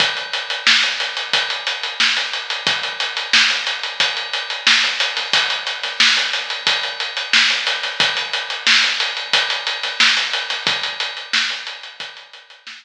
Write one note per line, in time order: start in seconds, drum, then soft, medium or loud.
0.00 kick medium
0.00 closed hi-hat medium
0.17 closed hi-hat medium
0.33 closed hi-hat medium
0.50 closed hi-hat medium
0.67 snare medium
0.83 closed hi-hat medium
1.00 snare soft
1.00 closed hi-hat medium
1.17 closed hi-hat medium
1.33 kick medium
1.33 closed hi-hat medium
1.50 closed hi-hat medium
1.67 closed hi-hat medium
1.83 closed hi-hat medium
2.00 snare medium
2.17 closed hi-hat medium
2.33 closed hi-hat medium
2.50 closed hi-hat medium
2.67 kick medium
2.67 closed hi-hat medium
2.83 closed hi-hat medium
3.00 closed hi-hat medium
3.17 closed hi-hat medium
3.33 snare medium
3.50 closed hi-hat medium
3.67 closed hi-hat medium
3.83 closed hi-hat medium
4.00 kick medium
4.00 closed hi-hat medium
4.17 closed hi-hat medium
4.33 closed hi-hat medium
4.50 closed hi-hat medium
4.67 snare medium
4.83 snare soft
4.83 closed hi-hat medium
5.00 closed hi-hat medium
5.17 snare soft
5.17 closed hi-hat medium
5.33 kick medium
5.33 closed hi-hat loud
5.50 closed hi-hat medium
5.67 closed hi-hat medium
5.83 snare soft
5.83 closed hi-hat medium
6.00 snare loud
6.17 closed hi-hat medium
6.33 snare soft
6.33 closed hi-hat medium
6.50 closed hi-hat medium
6.67 kick medium
6.67 closed hi-hat medium
6.83 closed hi-hat medium
7.00 closed hi-hat medium
7.17 closed hi-hat medium
7.33 snare medium
7.50 snare soft
7.50 closed hi-hat medium
7.67 snare soft
7.67 closed hi-hat medium
7.83 snare soft
7.83 closed hi-hat medium
8.00 kick loud
8.00 closed hi-hat medium
8.17 closed hi-hat medium
8.33 closed hi-hat medium
8.50 closed hi-hat medium
8.67 snare loud
8.83 closed hi-hat medium
9.00 closed hi-hat medium
9.17 closed hi-hat medium
9.33 kick medium
9.33 closed hi-hat medium
9.50 closed hi-hat medium
9.67 closed hi-hat medium
9.83 snare soft
9.83 closed hi-hat medium
10.00 snare medium
10.17 closed hi-hat medium
10.33 closed hi-hat medium
10.50 snare soft
10.50 closed hi-hat medium
10.67 kick loud
10.67 closed hi-hat medium
10.83 closed hi-hat medium
11.00 closed hi-hat medium
11.17 closed hi-hat medium
11.33 snare medium
11.50 closed hi-hat medium
11.67 closed hi-hat medium
11.83 closed hi-hat medium
12.00 kick medium
12.00 closed hi-hat medium
12.17 closed hi-hat medium
12.33 closed hi-hat medium
12.50 closed hi-hat medium
12.67 snare loud
12.83 closed hi-hat medium